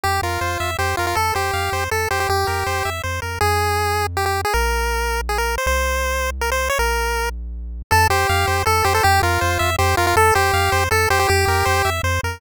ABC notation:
X:1
M:3/4
L:1/16
Q:1/4=160
K:F
V:1 name="Lead 1 (square)"
G2 F6 G2 F F | A2 G6 A2 G G | G8 z4 | [K:Fm] A8 G G2 A |
B8 A B2 c | c8 B c2 d | B6 z6 | [K:F] A2 G6 A2 G A |
G2 F6 G2 F F | A2 G6 A2 G G | G8 z4 |]
V:2 name="Lead 1 (square)"
G2 B2 c2 e2 c2 B2 | A2 c2 f2 c2 A2 c2 | G2 B2 c2 e2 c2 B2 | [K:Fm] z12 |
z12 | z12 | z12 | [K:F] A2 c2 f2 c2 A2 c2 |
G2 B2 c2 e2 c2 B2 | A2 c2 f2 c2 A2 c2 | G2 B2 c2 e2 c2 B2 |]
V:3 name="Synth Bass 1" clef=bass
F,,2 F,,2 F,,2 F,,2 F,,2 F,,2 | F,,2 F,,2 F,,2 F,,2 F,,2 F,,2 | F,,2 F,,2 F,,2 F,,2 F,,2 F,,2 | [K:Fm] F,,12 |
B,,,12 | C,,12 | B,,,12 | [K:F] F,,2 F,,2 F,,2 F,,2 F,,2 F,,2 |
F,,2 F,,2 F,,2 F,,2 F,,2 F,,2 | F,,2 F,,2 F,,2 F,,2 F,,2 F,,2 | F,,2 F,,2 F,,2 F,,2 F,,2 F,,2 |]